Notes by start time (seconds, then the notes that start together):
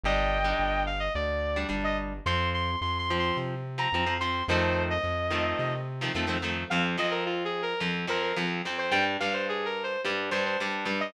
0.03 G1 G3 D4 D#5 G5
0.44 G3 D4
0.59 G1
0.86 F5
1.00 D#5
1.15 D2 D5
1.56 G3 D4
1.69 G1 G3 D4
1.84 D#5
2.26 F2 F3 C4 C6
2.54 C6
2.81 F2 C6
2.98 C6
3.10 F3 C4
3.19 C6
3.37 C3
3.78 F3 C4 A#5
3.92 F2 F3 C4
4.06 F3 C4
4.20 F3 C4 C6
4.48 F2 D#3 F3 A3 C4 C5
4.90 D#5
5.04 F2
5.30 D#3 F3 A3 C4
5.59 C3
6.01 D#3 F3 A3 C4
6.14 F2 D#3 F3 A3 C4
6.27 D#3 F3 A3 C4
6.42 D#3 F3 A3 C4
6.70 F2 F3 C4 F5
6.98 F2 F3 C4 D#5
7.11 A#4
7.26 F4
7.45 G#4
7.62 A#4
7.80 F2 F3 C4
8.07 F2 F3 C4 A#4
8.22 A#4
8.36 F2 F3 C4
8.65 F2 F3 C4
8.78 C5
8.91 G2 G3 D4 G5
9.20 G2 G3 D4 F5
9.33 C5
9.49 G#4
9.65 A#4
9.83 C5
10.05 G2 G3 D4
10.31 G2 G3 D4 C5
10.45 C5
10.60 G2 G3 D4
10.85 G2 G3 D4
11.00 D#5